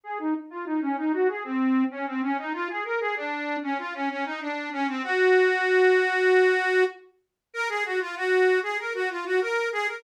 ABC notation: X:1
M:4/4
L:1/16
Q:1/4=96
K:Ebdor
V:1 name="Accordion"
A E z F E D E G A C3 D C D E | F A B A =D3 _D F D D E =D2 _D C | G12 z4 | B A G F G3 A B G F G B2 A B |]